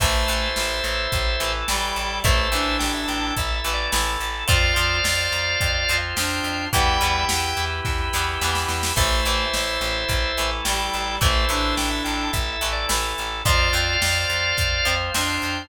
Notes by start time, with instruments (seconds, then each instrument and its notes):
0.00 electric bass (finger) A1, acoustic guitar (steel) E3 A3, clarinet A3, drawbar organ E4 A4 C5 E5, kick, crash
0.28 electric bass (finger) A1, acoustic guitar (steel) E3 A3, closed hi-hat
0.56 electric bass (finger) A1, snare
0.84 electric bass (finger) A1, closed hi-hat
1.12 electric bass (finger) A1, kick, closed hi-hat
1.40 electric bass (finger) A1, acoustic guitar (steel) E3 A3, closed hi-hat
1.68 electric bass (finger) A1, acoustic guitar (steel) E3 A3, clarinet G3, drawbar organ G5, snare
1.96 electric bass (finger) A1, closed hi-hat
2.24 electric bass (finger) A1, acoustic guitar (steel) E3 A3, clarinet A3, drawbar organ E4 A4 C5 E5, kick, closed hi-hat
2.52 electric bass (finger) A1, acoustic guitar (steel) E3 A3, clarinet D4, closed hi-hat
2.79 electric bass (finger) A1, drawbar organ G5, snare
2.94 drawbar organ E5
3.08 electric bass (finger) A1, drawbar organ G5, closed hi-hat
3.37 electric bass (finger) A1, drawbar organ E5, kick, closed hi-hat
3.55 drawbar organ E5
3.64 electric bass (finger) A1, acoustic guitar (steel) E3 A3, closed hi-hat
3.73 drawbar organ D5
3.92 electric bass (finger) A1, acoustic guitar (steel) E3 A3, snare
4.20 electric bass (finger) A1, closed hi-hat
4.48 electric bass (finger) F2, acoustic guitar (steel) F3 C4, drawbar organ F4 C5 D5 F5, clarinet F4, kick, closed hi-hat
4.76 electric bass (finger) F2, acoustic guitar (steel) F3 C4, closed hi-hat
5.04 electric bass (finger) F2, snare
5.32 electric bass (finger) F2, closed hi-hat
5.61 electric bass (finger) F2, kick, closed hi-hat
5.89 electric bass (finger) F2, acoustic guitar (steel) F3 C4, closed hi-hat
6.16 electric bass (finger) F2, acoustic guitar (steel) F3 C4, clarinet D4, drawbar organ G5, snare
6.44 electric bass (finger) F2, closed hi-hat
6.73 electric bass (finger) E2, acoustic guitar (steel) E3 G3 B3, clarinet G3, drawbar organ E4 G4 B4 E5 G5, kick, closed hi-hat
7.01 electric bass (finger) E2, acoustic guitar (steel) E3 G3 B3, closed hi-hat
7.29 electric bass (finger) E2, snare
7.57 electric bass (finger) E2, closed hi-hat
7.85 electric bass (finger) E2, kick, snare
8.13 electric bass (finger) E2, acoustic guitar (steel) E3 G3 B3, snare
8.41 electric bass (finger) E2, acoustic guitar (steel) E3 G3 B3, snare
8.55 snare
8.68 electric bass (finger) E2, snare
8.83 snare
8.96 electric bass (finger) A1, acoustic guitar (steel) E3 A3, clarinet A3, drawbar organ E4 A4 C5 E5, kick, crash
9.25 electric bass (finger) A1, acoustic guitar (steel) E3 A3, closed hi-hat
9.54 electric bass (finger) A1, snare
9.81 electric bass (finger) A1, closed hi-hat
10.09 electric bass (finger) A1, kick, closed hi-hat
10.37 electric bass (finger) A1, acoustic guitar (steel) E3 A3, closed hi-hat
10.65 electric bass (finger) A1, acoustic guitar (steel) E3 A3, clarinet G3, drawbar organ G5, snare
10.93 electric bass (finger) A1, closed hi-hat
11.21 electric bass (finger) A1, acoustic guitar (steel) E3 A3, clarinet A3, drawbar organ E4 A4 C5 E5, kick, closed hi-hat
11.49 electric bass (finger) A1, acoustic guitar (steel) E3 A3, clarinet D4, closed hi-hat
11.77 electric bass (finger) A1, drawbar organ G5, snare
11.90 drawbar organ E5
12.04 electric bass (finger) A1, drawbar organ G5, closed hi-hat
12.33 electric bass (finger) A1, drawbar organ E5, kick, closed hi-hat
12.53 drawbar organ E5
12.61 electric bass (finger) A1, acoustic guitar (steel) E3 A3, closed hi-hat
12.73 drawbar organ D5
12.89 electric bass (finger) A1, acoustic guitar (steel) E3 A3, snare
13.18 electric bass (finger) A1, closed hi-hat
13.45 electric bass (finger) F2, acoustic guitar (steel) F3 C4, clarinet F4, drawbar organ F4 C5 D5 F5, kick, closed hi-hat
13.73 electric bass (finger) F2, acoustic guitar (steel) F3 C4, closed hi-hat
14.02 electric bass (finger) F2, snare
14.29 electric bass (finger) F2, closed hi-hat
14.57 electric bass (finger) F2, kick, closed hi-hat
14.85 electric bass (finger) F2, acoustic guitar (steel) F3 C4, closed hi-hat
15.14 electric bass (finger) F2, acoustic guitar (steel) F3 C4, clarinet D4, drawbar organ G5, snare
15.42 electric bass (finger) F2, closed hi-hat